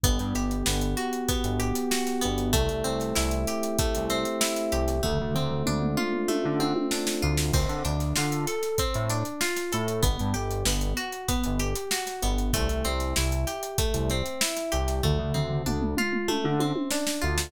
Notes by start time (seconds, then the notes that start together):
0.04 G1 B3, kick, closed hi-hat
0.19 G2, closed hi-hat
0.35 G1 G4, snare, closed hi-hat
0.51 closed hi-hat
0.66 G1 B3, snare
0.81 closed hi-hat
0.97 F#4, closed hi-hat
1.13 closed hi-hat
1.29 B3, kick, closed hi-hat
1.44 G1, closed hi-hat
1.60 G4, closed hi-hat
1.75 closed hi-hat
1.91 F#4, snare
2.07 snare, closed hi-hat
2.21 G1 B3, closed hi-hat
2.38 closed hi-hat
2.53 C2 A3, kick, closed hi-hat
2.69 C2, closed hi-hat
2.84 C2 C4, closed hi-hat
3.00 snare, closed hi-hat
3.15 C2 E4, snare
3.31 snare, closed hi-hat
3.47 G4, snare, closed hi-hat
3.63 closed hi-hat
3.79 A3, kick, closed hi-hat
3.95 C2, closed hi-hat
4.10 C4, snare, closed hi-hat
4.25 closed hi-hat
4.41 E4, snare
4.56 snare, closed hi-hat
4.72 C2 G4, closed hi-hat
4.88 snare, closed hi-hat
5.03 D2 A3, kick, floor tom
5.19 D2, floor tom
5.34 D2 C4, floor tom
5.50 floor tom
5.66 D2 D4, mid tom
5.82 mid tom
5.97 F4, mid tom
6.13 mid tom
6.28 A3, high tom
6.44 D3, high tom
6.60 C4, high tom
6.76 high tom
6.91 D4, snare
7.07 snare
7.22 D2 F4
7.38 snare
7.52 D2 C4, kick, crash
7.69 D3, closed hi-hat
7.85 D2 D4, closed hi-hat
8.00 snare, closed hi-hat
8.16 D3 F4, snare
8.32 snare, closed hi-hat
8.47 A4, snare, closed hi-hat
8.63 snare, closed hi-hat
8.78 C4, kick, closed hi-hat
8.94 A2, closed hi-hat
9.10 D4, closed hi-hat
9.25 closed hi-hat
9.41 F4, snare
9.56 snare, closed hi-hat
9.72 A2 A4, snare, closed hi-hat
9.88 closed hi-hat
10.03 G1 B3, kick, closed hi-hat
10.19 G2, closed hi-hat
10.34 G1 G4, snare, closed hi-hat
10.51 closed hi-hat
10.65 G1 B3, snare
10.81 closed hi-hat
10.97 F#4, closed hi-hat
11.12 closed hi-hat
11.28 B3, kick, closed hi-hat
11.44 G1, closed hi-hat
11.59 G4, closed hi-hat
11.76 closed hi-hat
11.91 F#4, snare
12.07 snare, closed hi-hat
12.22 G1 B3, closed hi-hat
12.38 closed hi-hat
12.53 C2 A3, kick, closed hi-hat
12.69 C2, closed hi-hat
12.85 C2 C4, closed hi-hat
13.00 snare, closed hi-hat
13.16 C2 E4, snare
13.31 snare, closed hi-hat
13.47 G4, snare, closed hi-hat
13.63 closed hi-hat
13.78 A3, kick, closed hi-hat
13.94 C2, closed hi-hat
14.10 C4, snare, closed hi-hat
14.26 closed hi-hat
14.41 E4, snare
14.57 snare, closed hi-hat
14.72 C2 G4, closed hi-hat
14.88 snare, closed hi-hat
15.03 D2 A3, kick, floor tom
15.19 D2, floor tom
15.34 D2 C4, floor tom
15.51 floor tom
15.66 D2 D4, mid tom
15.81 mid tom
15.97 F4, mid tom
16.13 mid tom
16.28 A3, high tom
16.44 D3, high tom
16.60 C4, high tom
16.76 high tom
16.90 D4, snare
17.07 snare
17.21 D2 F4
17.38 snare